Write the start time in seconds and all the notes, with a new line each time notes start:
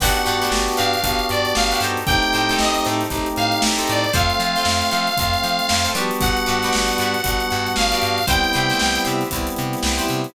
0.00 G1 B3 D4 F#4 G4 B4 F#5, kick, crash
0.16 snare, closed hi-hat
0.25 G2 D4 F#4 G4 B4, closed hi-hat
0.41 D4 F#4 G4 B4, snare, closed hi-hat
0.52 G1, snare
0.68 closed hi-hat
0.77 G2 D4 F#4 G4 B4 F5, closed hi-hat
0.94 closed hi-hat
1.03 G1 B3 D4 F#4 G4, kick, closed hi-hat
1.19 closed hi-hat
1.29 G2 D5, closed hi-hat
1.45 closed hi-hat
1.55 G1 F5, snare
1.72 D4 F#4 G4 B4, closed hi-hat
1.80 G2 G4 A4 C5, closed hi-hat
1.85 D#4
1.97 closed hi-hat
2.06 A1 A3 C4 D#4 G4 G5, kick, closed hi-hat
2.22 snare, closed hi-hat
2.33 A2 D#4 G4 A4 C5, closed hi-hat
2.49 D#4 G4 A4 C5, snare, closed hi-hat
2.59 A1 D#5, snare
2.74 snare, closed hi-hat
2.85 A2 D#4 G4 A4 C5, closed hi-hat
3.01 snare, closed hi-hat
3.10 A1 A3 C4 D#4 G4, kick, closed hi-hat
3.26 closed hi-hat
3.36 A2 F5, closed hi-hat
3.52 closed hi-hat
3.62 A1, snare
3.78 D#4 G4 A4 C5, closed hi-hat
3.87 A2 D5, closed hi-hat
4.04 closed hi-hat
4.13 F2 A3 C4 F4 A4 C5 F5, kick, closed hi-hat
4.30 closed hi-hat
4.40 F3 F4 A4 C5, closed hi-hat
4.55 F4 A4 C5, snare, closed hi-hat
4.65 F2, snare
4.82 closed hi-hat
4.91 F3 F4 A4 C5, closed hi-hat
5.07 closed hi-hat
5.17 F2 A3 C4 F4, kick, closed hi-hat
5.34 closed hi-hat
5.43 F3, closed hi-hat
5.59 closed hi-hat
5.69 F2, snare
5.84 F4 A4 C5, closed hi-hat
5.95 F3 G3 B3 D4 F#4 G4 B4 D5, closed hi-hat
6.11 closed hi-hat
6.20 G1 F#5, kick, closed hi-hat
6.37 closed hi-hat
6.46 G2 F#4 G4 B4 D5, closed hi-hat
6.62 F#4 G4 B4 D5, snare, closed hi-hat
6.73 G1, snare
6.88 snare, closed hi-hat
6.98 G2 F#4 G4 B4 D5, closed hi-hat
7.14 closed hi-hat
7.24 G1 G3 B3 D4 F#4, kick, closed hi-hat
7.40 closed hi-hat
7.50 G2, snare, closed hi-hat
7.66 snare, closed hi-hat
7.76 G1 F5, snare
7.92 F#4 G4 B4 D5, closed hi-hat
8.02 G2, closed hi-hat
8.18 closed hi-hat
8.27 C2 G3 B3 C4 E4 G4 B4 C5 G5, kick, closed hi-hat
8.44 closed hi-hat
8.53 C3 E4 G4 B4 C5, closed hi-hat
8.70 E4 G4 B4 C5, snare, closed hi-hat
8.79 C2, snare
8.95 closed hi-hat
9.05 C3 E4 G4 B4 C5, closed hi-hat
9.21 snare, closed hi-hat
9.31 C2 G3 B3 C4 E4, kick, closed hi-hat
9.47 closed hi-hat
9.56 C3, closed hi-hat
9.73 snare, closed hi-hat
9.83 C2, snare
9.98 E4 G4 B4 C5, closed hi-hat
10.08 C3, closed hi-hat
10.24 closed hi-hat